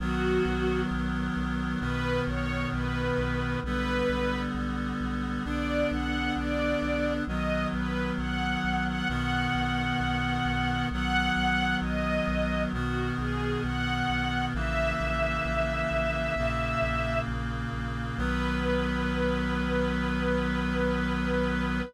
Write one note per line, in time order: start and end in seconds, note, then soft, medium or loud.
0.00 0.39 B1 medium
0.00 1.80 D#3 loud
0.00 1.80 F#3 loud
0.00 1.80 B3 loud
0.00 0.81 F#4 loud
0.45 0.84 B1 medium
0.91 1.29 B1 medium
1.36 1.75 B1 medium
1.80 2.20 B1 medium
1.80 3.60 B2 loud
1.80 3.60 D#3 loud
1.80 3.60 B3 loud
1.80 2.21 B4 loud
2.27 2.66 B1 medium
2.27 2.68 C#5 loud
2.73 3.12 B1 medium
2.73 3.58 B4 medium
3.18 3.57 B1 medium
3.63 4.02 B1 medium
3.63 5.44 D3 loud
3.63 5.45 G3 medium
3.63 5.44 B3 loud
3.63 4.41 B4 loud
4.09 4.48 B1 medium
4.55 4.93 B1 medium
5.00 5.39 B1 medium
5.45 5.84 B1 medium
5.45 7.25 D3 medium
5.45 7.25 B3 medium
5.45 7.25 D4 medium
5.45 5.88 D5 medium
5.91 6.30 B1 medium
5.91 6.32 F#5 medium
6.36 6.75 B1 medium
6.36 7.13 D5 loud
6.82 7.20 B1 medium
7.27 7.66 B1 medium
7.27 9.08 D#3 medium
7.27 9.08 F#3 loud
7.27 9.08 B3 medium
7.27 7.67 D#5 medium
7.73 8.12 B1 medium
7.73 8.11 B4 medium
8.18 8.57 B1 medium
8.18 8.84 F#5 medium
8.64 9.02 B1 medium
8.86 9.08 F#5 loud
9.09 9.48 B1 medium
9.09 10.89 B2 loud
9.09 10.89 D#3 loud
9.09 10.89 B3 loud
9.09 10.85 F#5 medium
9.55 9.93 B1 medium
10.00 10.39 B1 medium
10.45 10.84 B1 medium
10.91 11.30 B1 loud
10.91 12.73 D#3 medium
10.91 12.73 F#3 loud
10.91 12.73 B3 medium
10.91 11.76 F#5 loud
11.36 11.75 B1 medium
11.82 12.20 B1 medium
11.82 12.63 D#5 loud
12.27 12.66 B1 loud
12.73 13.11 B1 medium
12.73 14.53 B2 loud
12.73 14.53 D#3 medium
12.73 14.53 B3 loud
12.73 13.12 F#4 medium
13.18 13.57 B1 medium
13.18 13.62 G#4 medium
13.64 14.02 B1 medium
13.64 14.45 F#5 loud
14.09 14.48 B1 medium
14.54 14.93 A#1 loud
14.54 16.34 C#3 loud
14.54 16.34 E3 loud
14.54 16.34 A#3 medium
14.54 17.19 E5 loud
15.00 15.39 A#1 medium
15.45 15.84 A#1 medium
15.91 16.30 A#1 medium
16.36 16.75 A#1 medium
16.36 18.18 A#2 medium
16.36 18.18 C#3 loud
16.36 18.18 A#3 loud
16.82 17.21 A#1 medium
17.27 17.66 A#1 medium
17.73 18.11 A#1 medium
18.17 21.82 B1 loud
18.17 21.81 D#3 loud
18.17 21.81 F#3 loud
18.17 21.81 B3 loud
18.17 21.82 B4 loud